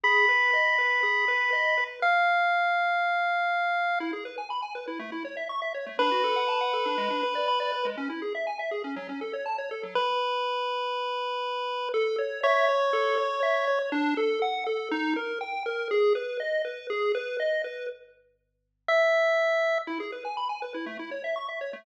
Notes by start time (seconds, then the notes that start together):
0.04 G#4 B5
0.29 B4
0.53 D#5
0.78 B4
1.03 G#4
1.28 B4
1.53 D#5
1.77 B4
2.02 F5
4.00 E4
4.13 G#4
4.25 B4
4.38 G#5
4.50 B5
4.62 G#5
4.75 B4
4.88 E4
4.99 A3
5.12 E4
5.25 C#5
5.37 E5
5.49 C#6
5.62 E5
5.74 C#5
5.86 A3
5.99 D4 B4
6.11 F#4
6.24 A4
6.36 F#5
6.48 A5
6.61 F#5
6.73 A4
6.86 D4
6.98 G#3
7.10 D4
7.23 B4
7.35 D5
7.48 B5
7.60 D5
7.72 B4
7.85 G#3
7.97 C#4
8.10 E4
8.22 G#4
8.35 E5
8.47 G#5
8.59 E5
8.71 G#4
8.84 C#4
8.96 F#3
9.09 C#4
9.21 A4
9.33 C#5
9.46 A5
9.58 C#5
9.71 A4
9.83 F#3
9.95 B4
11.94 A4
12.18 C#5
12.43 C#5 E5
12.69 C#5
12.93 A4
13.18 C#5
13.43 E5
13.67 C#5
13.92 D4
14.17 A4
14.42 F#5
14.67 A4
14.91 D#4
15.16 A#4
15.41 G5
15.66 A#4
15.91 G#4
16.15 B4
16.40 D#5
16.65 B4
16.90 G#4
17.15 B4
17.40 D#5
17.64 B4
18.88 E5
19.87 E4
20.00 G#4
20.12 B4
20.25 G#5
20.37 B5
20.49 G#5
20.62 B4
20.74 E4
20.86 A3
20.99 E4
21.11 C#5
21.24 E5
21.36 C#6
21.48 E5
21.61 C#5
21.73 A3